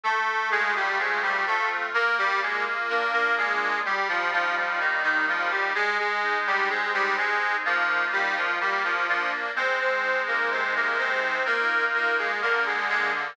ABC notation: X:1
M:4/4
L:1/16
Q:1/4=63
K:Eb
V:1 name="Accordion"
[=A,=A]2 [_A,_A] [G,G] [A,A] [G,G] [=A,=A] z | [B,B] [G,G] [A,A] z [B,B] [B,B] [A,A]2 [G,G] [F,F] [F,F] [F,F] [E,E] [E,E] [F,F] [G,G] | [A,A] [A,A]2 [G,G] [A,A] [G,G] [A,A]2 [F,F]2 [G,G] [F,F] [G,G] [F,F] [F,F] z | [Cc] [Cc]2 [B,B] [Cc] [B,B] [Cc]2 [B,B]2 [B,B] [A,A] [B,B] [A,A] [A,A] z |]
V:2 name="Accordion"
=A,2 F2 C2 F2 | B,2 F2 D2 F2 G,2 E2 B,2 E2 | A,2 E2 C2 E2 [B,EF]4 B,2 D2 | A,2 E2 C,2 E2 [B,EF]4 D,2 B,2 |]